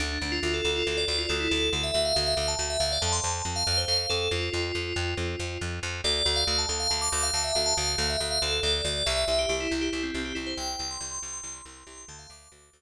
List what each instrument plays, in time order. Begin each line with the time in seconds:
0.00 electric bass (finger) D2, tubular bells D4
0.21 electric bass (finger) D2, tubular bells D4
0.32 tubular bells F4
0.43 electric bass (finger) D2, tubular bells F4
0.54 tubular bells A4
0.64 electric bass (finger) D2, tubular bells A4
0.76 tubular bells F4
0.87 electric bass (finger) D2, tubular bells A4
0.97 tubular bells D5
1.08 electric bass (finger) D2, tubular bells D5
1.19 tubular bells F4
1.29 electric bass (finger) D2, tubular bells A4
1.40 tubular bells E4
1.51 electric bass (finger) D2, tubular bells A4
1.73 electric bass (finger) D2, tubular bells A4
1.83 tubular bells E5
1.94 electric bass (finger) D2, tubular bells E5
2.05 tubular bells F5
2.15 electric bass (finger) D2, tubular bells F5
2.27 tubular bells E5
2.37 electric bass (finger) D2, tubular bells F5
2.48 tubular bells A5
2.59 electric bass (finger) D2, tubular bells A5
2.70 tubular bells E5
2.80 electric bass (finger) D2, tubular bells F5
2.92 tubular bells D5
3.02 electric bass (finger) F2, tubular bells A5
3.12 tubular bells C6
3.24 electric bass (finger) F2, tubular bells A5
3.45 electric bass (finger) F2
3.56 tubular bells F5
3.67 electric bass (finger) F2, tubular bells F5
3.77 tubular bells C5
3.88 electric bass (finger) F2, tubular bells F5
4.10 electric bass (finger) F2, tubular bells A4
4.31 electric bass (finger) F2, tubular bells F4
4.53 electric bass (finger) F2, tubular bells F4
4.75 electric bass (finger) F2
4.96 electric bass (finger) F2
5.17 electric bass (finger) F2
5.39 electric bass (finger) F2
5.61 electric bass (finger) F2
5.83 electric bass (finger) F2
6.04 electric bass (finger) D2, tubular bells D5
6.25 electric bass (finger) D2, tubular bells D5
6.36 tubular bells F5
6.47 electric bass (finger) D2, tubular bells F5
6.58 tubular bells A5
6.69 electric bass (finger) D2, tubular bells A5
6.80 tubular bells F5
6.90 electric bass (finger) D2, tubular bells A5
7.01 tubular bells D6
7.12 electric bass (finger) D2, tubular bells D6
7.23 tubular bells F5
7.34 electric bass (finger) D2, tubular bells A5
7.44 tubular bells E5
7.55 electric bass (finger) D2, tubular bells F5
7.66 tubular bells A5
7.77 electric bass (finger) D2, tubular bells F5
7.98 electric bass (finger) D2
8.10 tubular bells E5
8.20 electric bass (finger) D2, tubular bells E5
8.31 tubular bells F5
8.42 electric bass (finger) D2, tubular bells A4
8.63 electric bass (finger) D2, tubular bells D5
8.85 electric bass (finger) D2, tubular bells D5
9.06 electric bass (finger) C2, tubular bells E5
9.28 electric bass (finger) C2, tubular bells E5
9.39 tubular bells G4
9.49 electric bass (finger) C2, tubular bells G4
9.60 tubular bells E4
9.71 electric bass (finger) C2, tubular bells E4
9.81 tubular bells G4
9.93 electric bass (finger) C2, tubular bells E4
10.03 tubular bells C4
10.14 electric bass (finger) C2, tubular bells C4
10.25 tubular bells G4
10.35 electric bass (finger) C2, tubular bells E4
10.46 tubular bells C5
10.57 electric bass (finger) C2, tubular bells G5
10.79 electric bass (finger) C2, tubular bells G5
10.91 tubular bells C6
11.01 electric bass (finger) C2, tubular bells C6
11.11 tubular bells C6
11.22 electric bass (finger) C2, tubular bells C6
11.34 tubular bells C6
11.43 electric bass (finger) C2, tubular bells C6
11.54 tubular bells C6
11.65 electric bass (finger) C2, tubular bells C6
11.77 tubular bells C6
11.87 electric bass (finger) C2, tubular bells C6
11.97 tubular bells C6
12.08 electric bass (finger) D2, tubular bells A5
12.19 tubular bells F5
12.30 electric bass (finger) D2, tubular bells D6
12.52 electric bass (finger) D2
12.73 electric bass (finger) D2